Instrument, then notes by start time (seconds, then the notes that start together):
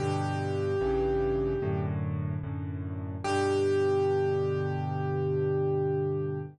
acoustic grand piano
0.00 G2 B2 D3 G4
0.81 A1 G2 C#3 E3
1.62 F#2 A2 D3
2.43 F#2 A2 D3
3.24 G2 B2 D3 G4